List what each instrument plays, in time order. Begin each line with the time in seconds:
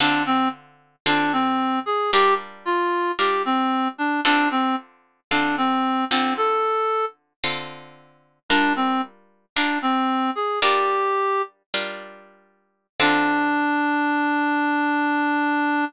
0.00 acoustic guitar (steel) D3 C4 F4 A4, clarinet D4
0.26 clarinet C4
1.06 acoustic guitar (steel) D3 C4 F4 A4, clarinet D4
1.33 clarinet C4
1.86 clarinet G#4
2.12 acoustic guitar (steel) G3 D4 F4 A#4, clarinet G4
2.65 clarinet F4
3.19 acoustic guitar (steel) G3 D4 F4 A#4, clarinet G4
3.45 clarinet C4
3.98 clarinet D4
4.25 acoustic guitar (steel) D3 C4 F4 A4, clarinet D4
4.51 clarinet C4
5.31 acoustic guitar (steel) D3 C4 F4 A4, clarinet D4
5.58 clarinet C4
6.11 acoustic guitar (steel) D3 C4 F4 A4, clarinet C4
6.37 clarinet A4
7.44 acoustic guitar (steel) D3 C4 F4 A4
8.49 acoustic guitar (steel) G3 D4 F4 A#4, clarinet D4
8.76 clarinet C4
9.56 acoustic guitar (steel) G3 D4 F4 A#4, clarinet D4
9.82 clarinet C4
10.35 clarinet G#4
10.62 acoustic guitar (steel) G3 D4 F4 A#4, clarinet G4
11.74 acoustic guitar (steel) G3 D4 F4 A#4
13.00 acoustic guitar (steel) D3 C4 F4 A4, clarinet D4